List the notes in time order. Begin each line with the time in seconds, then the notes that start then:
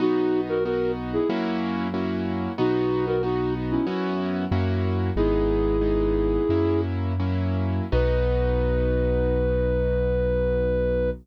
0.00 B1 B3 D#4 F#4
0.49 F#4 A#4
0.64 B3 D#4 F#4 A#4
1.13 E4 G#4
1.29 F#2 A#3 C#4 E4 F#4
1.94 A#3 C#4 E4 F#4
2.58 B1 B3 D#4 F#4
3.07 F#4 A#4
3.23 B3 D#4 F#4
3.71 C#4 E4
3.87 F#2 B3 C#4 E4 F#4
4.51 F#2 A#3 C#4 E4 F#4
5.16 G#1 G#3 B3 D#4 E4 G#4
5.81 G#3 B3 D#4
6.49 F#2 F#3 A#3 C#4 E4
7.20 F#3 A#3 C#4 E4
7.92 B1 B3 D#4 F#4 B4